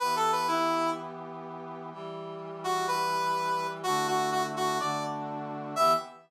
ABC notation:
X:1
M:4/4
L:1/16
Q:1/4=125
K:Edor
V:1 name="Brass Section"
(3B2 A2 B2 E4 z8 | z6 F2 B8 | F2 F2 F z F2 d2 z6 | e4 z12 |]
V:2 name="Brass Section"
[E,B,G]16 | [E,G,G]16 | [D,A,EF]8 [D,A,DF]8 | [E,B,G]4 z12 |]